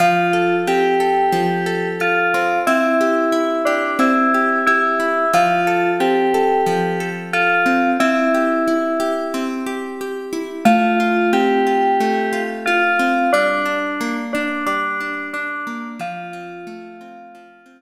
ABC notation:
X:1
M:4/4
L:1/8
Q:1/4=90
K:F
V:1 name="Electric Piano 2"
F2 G4 F2 | E3 D E2 E2 | F2 G4 F2 | E4 z4 |
F2 G4 F2 | D3 D D2 D2 | F6 z2 |]
V:2 name="Acoustic Guitar (steel)"
F, A C A F, A A C | C G E G C G G E | F, A C A F, A A C | C G E G C G G E |
A, F C F A, F F C | G, D B, D G, D D B, | F, C A, C F, C z2 |]